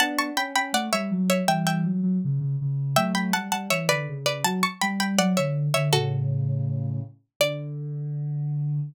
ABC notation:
X:1
M:2/2
L:1/8
Q:1/2=81
K:D
V:1 name="Pizzicato Strings"
[fa] [ac'] [gb] [gb] [df] [ce]2 [ce] | [eg] [eg]4 z3 | [eg] [gb] [fa] [fa] [ce] [Bd]2 [Bd] | [fa] [ac'] [gb] [gb] [df] [ce]2 [ce] |
[FA]6 z2 | d8 |]
V:2 name="Ocarina"
[B,D]2 C C A, G, F,2 | [E,G,]2 F, F, C, C, C,2 | [F,A,]2 G, G, E, D, C,2 | F, z G,2 F, D,2 D, |
[A,,C,]6 z2 | D,8 |]